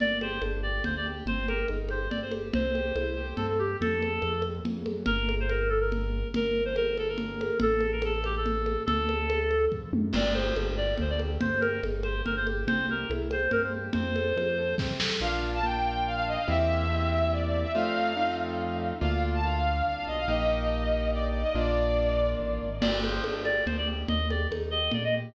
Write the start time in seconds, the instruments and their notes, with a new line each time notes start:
0.00 acoustic grand piano G1 A#3, clarinet D5, low conga
0.21 acoustic grand piano G4, clarinet C5, high conga
0.42 acoustic grand piano G1 D4, high conga
0.63 acoustic grand piano G4, clarinet D5
0.84 acoustic grand piano D2 A#3, clarinet C5, low conga
0.97 clarinet D5
1.06 acoustic grand piano G4
1.26 acoustic grand piano G1 C4, clarinet C5, low conga
1.48 acoustic grand piano G4, clarinet A#4, high conga
1.68 acoustic grand piano G1 D#4, high conga
1.89 acoustic grand piano G4, clarinet C5, high conga
2.10 acoustic grand piano G1 C4, clarinet D5, low conga
2.22 clarinet C5
2.31 acoustic grand piano G4, high conga
2.53 acoustic grand piano C2 C4, clarinet C5, low conga
2.74 acoustic grand piano G4, high conga
2.96 acoustic grand piano C2 E4, high conga
3.17 acoustic grand piano G4
3.36 acoustic grand piano G2 C4, clarinet A4, low conga
3.49 clarinet A4
3.59 clarinet G4, acoustic grand piano G4
3.81 acoustic grand piano F2, clarinet A4, low conga
4.02 high conga
4.22 acoustic grand piano F2, high conga
4.42 high conga
4.65 acoustic grand piano F2, low conga
4.86 acoustic grand piano F#2, high conga
5.06 acoustic grand piano G1, clarinet A#4, low conga
5.29 high conga
5.40 clarinet C5
5.49 clarinet A#4, high conga
5.69 clarinet A4
5.80 clarinet A#4
5.92 low conga
6.34 acoustic grand piano G1, clarinet A#4, low conga
6.65 clarinet C5
6.76 clarinet A#4, high conga
6.97 clarinet A4, high conga
7.08 clarinet A#4
7.18 low conga
7.41 high conga
7.60 acoustic grand piano A1, clarinet A4, low conga
7.81 high conga
7.92 clarinet A#4
8.02 clarinet A4, high conga
8.24 clarinet G4, high conga
8.37 clarinet A4
8.46 low conga
8.66 high conga
8.86 acoustic grand piano D2, clarinet A4, low conga
9.09 high conga
9.30 high conga
9.51 high conga
9.72 acoustic grand piano F2, kick
9.93 acoustic grand piano F#2, mid tom
10.13 acoustic grand piano G1 A#3, clarinet D5, crash, low conga
10.34 acoustic grand piano G4, clarinet C5, high conga
10.56 acoustic grand piano G1 D4, high conga
10.77 acoustic grand piano G4, clarinet D5
10.98 acoustic grand piano D2 A#3, clarinet C5, low conga
11.10 clarinet D5
11.19 acoustic grand piano G4, high conga
11.40 acoustic grand piano G1 C4, clarinet C5, low conga
11.61 acoustic grand piano G4, clarinet A#4, high conga
11.83 acoustic grand piano G1 D#4, high conga
12.03 acoustic grand piano G4, clarinet C5, high conga
12.25 acoustic grand piano G1 C4, clarinet A#4, low conga
12.37 clarinet C5
12.46 acoustic grand piano G4, high conga
12.67 acoustic grand piano C2 C4, clarinet C5, low conga
12.89 acoustic grand piano G4, clarinet A#4
13.09 acoustic grand piano C2 E4, high conga
13.31 acoustic grand piano G4, clarinet C5, high conga
13.51 acoustic grand piano G2 C4, clarinet A#4, low conga
13.63 clarinet C5
13.73 acoustic grand piano G4
13.93 acoustic grand piano F2 C4, clarinet C5, low conga
14.16 acoustic grand piano A4, high conga
14.36 acoustic grand piano F2 F4, high conga
14.58 acoustic grand piano A4
14.78 acoustic grand piano C3 C4, kick, snare
15.00 acoustic grand piano A4, snare
15.21 acoustic grand piano A#1 A#3 D4 F4, violin F5
15.31 violin F5
15.54 violin A5
15.63 acoustic grand piano A#3 D4 F4, violin G5
16.06 violin F5
16.15 violin F5
16.27 violin D#5
16.38 violin F5
16.48 acoustic grand piano E2 A#3 C4 E4 G4, violin E5
16.90 acoustic grand piano A#3 C4 E4 G4
17.32 violin D5
17.46 violin D5
17.62 violin E5
17.74 acoustic grand piano F2 A3 C4 D#4 F4, violin F5
18.17 acoustic grand piano A3 C4 D#4 F4
19.01 acoustic grand piano D2 A#3 D4 F4, violin F5
19.12 violin F5
19.34 violin A5
19.43 acoustic grand piano A#3 D4 F4, violin F5
19.86 acoustic grand piano C2, violin F5
19.95 violin F5
20.07 acoustic grand piano B1, violin D#5
20.18 violin F5
20.27 acoustic grand piano A#1 A#3 D#4 G4, violin D#5
21.12 violin D5
21.29 violin D5
21.41 violin D#5
21.54 acoustic grand piano A#1 A#3 D4 F4, violin D5
22.39 acoustic grand piano A1
22.62 acoustic grand piano G#1
22.81 acoustic grand piano G1 A#3, clarinet D5, crash, low conga
23.02 acoustic grand piano G4, clarinet C5, high conga
23.24 acoustic grand piano G1 D4, high conga
23.45 acoustic grand piano G4, clarinet D5, high conga
23.66 acoustic grand piano D2 A#3, clarinet C5, low conga
23.78 clarinet D5
23.87 acoustic grand piano G4
24.08 acoustic grand piano D#2 A#3, clarinet D#5, low conga
24.30 acoustic grand piano G4, clarinet D5, high conga
24.51 acoustic grand piano D#2 D#4, high conga
24.71 acoustic grand piano G4, clarinet D#5
24.91 acoustic grand piano A#2 A#3, clarinet D5, low conga
25.04 clarinet D#5
25.14 acoustic grand piano G4